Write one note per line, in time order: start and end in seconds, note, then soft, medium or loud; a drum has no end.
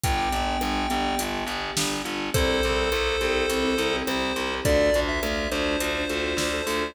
0.03 0.29 G1 loud
0.03 0.38 B3 medium
0.03 0.38 D4 medium
0.03 0.38 G4 loud
0.03 0.17 G5 medium
0.03 kick medium
0.03 closed hi-hat medium
0.17 1.23 G5 medium
0.32 0.57 G1 medium
0.32 closed hi-hat medium
0.47 0.81 B3 medium
0.47 0.81 D4 medium
0.47 0.81 G4 medium
0.61 0.86 G1 medium
0.61 cross-stick medium
0.90 1.15 G1 medium
0.90 1.36 B3 medium
0.90 1.36 D4 medium
0.90 1.36 G4 medium
0.90 closed hi-hat medium
1.19 1.44 G1 medium
1.19 closed hi-hat medium
1.46 1.71 G1 medium
1.46 1.94 B3 medium
1.46 1.94 D4 medium
1.46 1.94 G4 medium
1.46 closed hi-hat medium
1.77 2.02 G1 medium
1.77 snare loud
2.05 2.30 G1 medium
2.05 closed hi-hat medium
2.34 2.60 C2 loud
2.34 2.81 C4 loud
2.34 2.81 E4 medium
2.34 2.81 G4 medium
2.34 3.96 A4 loud
2.34 3.96 C5 loud
2.34 kick loud
2.34 closed hi-hat medium
2.63 2.89 C2 medium
2.63 closed hi-hat medium
2.92 3.16 C2 medium
2.92 3.15 C4 medium
2.92 3.15 E4 medium
2.92 3.15 G4 medium
2.92 cross-stick medium
3.21 3.46 C2 medium
3.21 3.55 C4 medium
3.21 3.55 E4 medium
3.21 3.55 G4 medium
3.21 closed hi-hat medium
3.49 3.74 C2 medium
3.49 closed hi-hat medium
3.64 3.87 C4 medium
3.64 3.87 E4 medium
3.64 3.87 G4 medium
3.78 4.02 C2 medium
3.78 closed hi-hat medium
3.93 4.16 C4 medium
3.93 4.16 E4 medium
3.93 4.16 G4 medium
4.07 4.32 C2 medium
4.07 4.55 C5 medium
4.07 cross-stick loud
4.22 4.33 C4 medium
4.22 4.33 E4 medium
4.22 4.33 G4 medium
4.36 4.60 C2 medium
4.36 4.47 C4 medium
4.36 4.47 E4 medium
4.36 4.47 G4 medium
4.36 closed hi-hat medium
4.51 4.62 C4 medium
4.51 4.62 E4 medium
4.51 4.62 G4 medium
4.65 4.90 D2 loud
4.65 5.12 D4 medium
4.65 5.12 F4 medium
4.65 5.12 A4 medium
4.65 5.00 D5 loud
4.65 kick medium
4.65 closed hi-hat medium
4.94 5.20 D2 medium
4.94 closed hi-hat medium
5.08 5.50 E5 medium
5.23 5.47 D2 medium
5.23 5.46 D4 medium
5.23 5.46 F4 medium
5.23 5.46 A4 medium
5.23 cross-stick medium
5.51 5.76 D2 medium
5.51 5.86 D4 medium
5.51 5.86 F4 medium
5.51 5.86 A4 medium
5.51 6.92 C5 medium
5.51 closed hi-hat medium
5.80 6.05 D2 medium
5.80 closed hi-hat medium
5.95 6.18 D4 medium
5.95 6.18 F4 medium
5.95 6.18 A4 medium
6.09 6.34 D2 medium
6.09 closed hi-hat medium
6.24 6.47 D4 medium
6.24 6.47 F4 medium
6.24 6.47 A4 medium
6.37 6.61 D2 medium
6.37 snare medium
6.53 6.64 D4 medium
6.53 6.64 F4 medium
6.53 6.64 A4 medium
6.67 6.91 D2 medium
6.67 6.78 D4 medium
6.67 6.78 F4 medium
6.67 6.78 A4 medium
6.67 open hi-hat medium
6.81 6.93 D4 medium
6.81 6.93 F4 medium
6.81 6.93 A4 medium